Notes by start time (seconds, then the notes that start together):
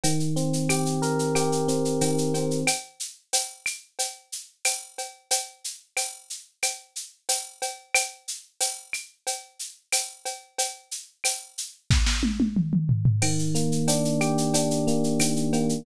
0.04 D#3, cowbell, shaker
0.20 shaker
0.36 C4, shaker
0.53 shaker
0.69 G4, tambourine, cowbell, claves, shaker
0.86 shaker
1.02 A#4, shaker
1.19 shaker
1.35 G4, cowbell, claves, shaker
1.52 shaker
1.68 C4, shaker
1.85 shaker
2.01 D#3, tambourine, cowbell, shaker
2.18 shaker
2.34 C4, cowbell, shaker
2.51 shaker
2.67 cowbell, claves, shaker
3.00 shaker
3.33 tambourine, cowbell, shaker
3.66 claves, shaker
3.99 cowbell, shaker
4.32 shaker
4.65 tambourine, cowbell, claves, shaker
4.98 cowbell, shaker
5.31 cowbell, shaker
5.64 shaker
5.97 tambourine, cowbell, claves, shaker
6.30 shaker
6.63 cowbell, claves, shaker
6.96 shaker
7.29 tambourine, cowbell, shaker
7.62 cowbell, shaker
7.94 cowbell, claves, shaker
8.28 shaker
8.61 tambourine, cowbell, shaker
8.93 claves, shaker
9.27 cowbell, shaker
9.59 shaker
9.92 tambourine, cowbell, claves, shaker
10.25 cowbell, shaker
10.58 cowbell, shaker
10.91 shaker
11.24 tambourine, cowbell, claves, shaker
11.58 shaker
11.90 kick, snare
12.06 snare
12.23 high tom
12.40 high tom
12.56 mid tom
12.73 mid tom
12.89 floor tom
13.05 floor tom
13.22 D#3, crash, cowbell, claves
13.39 shaker
13.55 A#3, shaker
13.72 shaker
13.88 D4, tambourine, cowbell, shaker
14.05 shaker
14.21 G4, claves, shaker
14.38 shaker
14.54 D4, cowbell, shaker
14.71 shaker
14.87 A#3, shaker
15.04 shaker
15.20 D#3, tambourine, cowbell, claves, shaker
15.36 shaker
15.53 A#3, cowbell, shaker
15.69 shaker